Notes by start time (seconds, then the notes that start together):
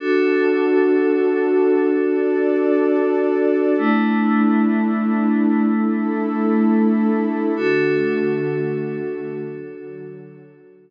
0.00 D4 F#4 A4
1.89 D4 A4 D5
3.78 A3 D4 E4
5.67 A3 E4 A4
7.56 D3 A3 D4 F#4 A4
9.45 D3 F#3 F#4